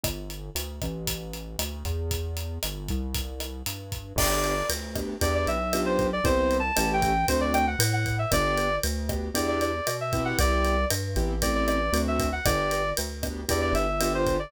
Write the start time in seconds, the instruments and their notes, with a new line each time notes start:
0.03 synth bass 1 G1, kick, cross-stick, closed hi-hat
0.30 closed hi-hat
0.55 synth bass 1 D2, closed hi-hat
0.82 synth bass 1 A1, kick, cross-stick, closed hi-hat
1.07 kick, closed hi-hat
1.34 closed hi-hat
1.59 synth bass 1 D2, cross-stick, closed hi-hat
1.85 synth bass 1 E2, kick, closed hi-hat
2.11 kick, closed hi-hat
2.37 closed hi-hat
2.63 synth bass 1 G1, cross-stick, closed hi-hat
2.88 synth bass 1 C2, kick, closed hi-hat
3.15 kick, closed hi-hat
3.40 cross-stick, closed hi-hat
3.66 synth bass 1 G2, closed hi-hat
3.92 kick, closed hi-hat
4.16 synth bass 1 G1, acoustic grand piano B3 D4 G4, clarinet D5, kick, cross-stick, crash
4.44 ride
4.69 synth bass 1 D2, ride
4.95 acoustic grand piano B3 D4 G4, kick, cross-stick, ride
5.21 synth bass 1 E2, acoustic grand piano B3 D4 E4 G4, clarinet D5, kick, ride
5.35 clarinet D5
5.47 synth bass 1 B1, clarinet E5, ride
5.73 acoustic grand piano B3 D4 F4 G4, cross-stick, ride
5.86 clarinet C5
5.99 kick, ride
6.13 clarinet D5
6.24 synth bass 1 C2, acoustic grand piano B3 C4 E4 G4, clarinet C5, kick, ride
6.51 ride
6.59 clarinet A5
6.77 synth bass 1 A1, acoustic grand piano A3 C#4 E4 G4, cross-stick, ride
6.93 clarinet G5
7.02 kick, ride
7.28 synth bass 1 D2, acoustic grand piano A3 C4 D4 F#4, clarinet C5, kick, ride
7.41 clarinet D5
7.54 clarinet G5, cross-stick, ride
7.67 clarinet F#5
7.79 synth bass 1 A2, ride
7.93 clarinet F#5
8.06 kick, ride
8.19 clarinet E5
8.32 synth bass 1 G1, acoustic grand piano B3 D4 G4, clarinet D5, kick, cross-stick, ride
8.58 ride
8.83 synth bass 1 D2, ride
9.09 acoustic grand piano B3 D4 G4, kick, cross-stick, ride
9.34 synth bass 1 E2, acoustic grand piano B3 D4 E4 G4, clarinet D5, kick, ride
9.48 clarinet D5
9.61 clarinet D5, ride
9.87 synth bass 1 B2, cross-stick, ride
10.01 clarinet E5
10.13 acoustic grand piano B3 C4 E4 G4, kick, ride
10.25 clarinet F#5
10.39 synth bass 1 C2, clarinet D5, kick, ride
10.65 ride
10.90 synth bass 1 G2, cross-stick, ride
11.16 synth bass 1 A1, acoustic grand piano B3 C4 E4 G4, kick, ride
11.42 acoustic grand piano A3 C4 E4 G4, clarinet D5, kick, ride
11.55 clarinet D5
11.67 clarinet D5, cross-stick, ride
11.93 synth bass 1 D2, acoustic grand piano A3 C4 D4 F#4, ride
12.08 clarinet E5
12.20 kick, ride
12.32 clarinet F#5
12.45 synth bass 1 G1, acoustic grand piano B3 D4 G4, clarinet D5, kick, cross-stick, ride
12.71 ride
12.97 synth bass 1 D2, ride
13.23 acoustic grand piano B3 D4 G4, kick, cross-stick, ride
13.49 synth bass 1 E2, acoustic grand piano B3 D4 E4 G4, clarinet D5, kick, ride
13.61 clarinet D5
13.73 synth bass 1 G1, clarinet E5, ride
14.01 acoustic grand piano B3 D4 F4 G4, cross-stick, ride
14.15 clarinet C5
14.27 kick, ride
14.39 clarinet D5